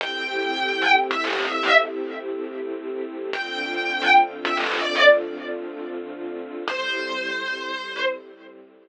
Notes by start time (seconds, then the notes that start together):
0.00 A3 C4 E4 G4 G5
1.11 E5
1.24 D#5
1.39 E5
3.33 D3 A3 C4 F4 G5
4.45 E5
4.57 D#5
4.71 D5
6.68 A2 G3 C4 E4 C5